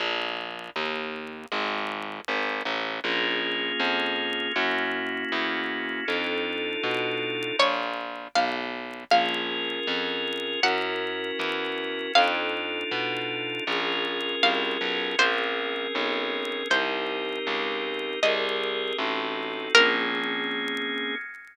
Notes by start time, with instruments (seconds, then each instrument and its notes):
0.00 electric bass (finger) A#1
0.76 electric bass (finger) D#2
1.52 electric bass (finger) G#1
2.28 electric bass (finger) G#1
2.65 electric bass (finger) A1
3.04 electric bass (finger) A#1, drawbar organ A#3 C#4 F4 G#4
3.80 electric bass (finger) F2
4.56 electric bass (finger) F#2, drawbar organ A#3 C#4 E4 F#4
5.32 electric bass (finger) E2
6.08 electric bass (finger) F2, drawbar organ D4 D#4 F4 A4
6.83 electric bass (finger) B2
7.59 electric bass (finger) A#1, pizzicato strings C#5
8.35 electric bass (finger) B1, pizzicato strings F5
9.11 electric bass (finger) A#1, drawbar organ C#4 F4 G#4 A#4, pizzicato strings F5
9.87 electric bass (finger) F2
10.63 electric bass (finger) F#2, drawbar organ C#4 E4 F#4 A#4, pizzicato strings F#5
11.39 electric bass (finger) E2
12.15 electric bass (finger) F2, drawbar organ D4 D#4 F4 A4, pizzicato strings F5
12.91 electric bass (finger) B2
13.67 electric bass (finger) A#1, drawbar organ C#4 F4 G#4 A#4
14.43 electric bass (finger) C2, pizzicato strings F5
14.81 electric bass (finger) B1
15.19 electric bass (finger) A#1, drawbar organ C4 C#4 G#4 A#4, pizzicato strings C5
15.95 electric bass (finger) B1
16.70 electric bass (finger) C2, drawbar organ C4 D#4 G4 A#4, pizzicato strings C5
17.47 electric bass (finger) C#2
18.23 electric bass (finger) C2, drawbar organ C4 G4 G#4 A#4, pizzicato strings D#5
18.98 electric bass (finger) A1, drawbar organ C4 D#4 F#4 A4
19.75 electric bass (finger) A#1, drawbar organ A#3 C4 C#4 G#4, pizzicato strings A#4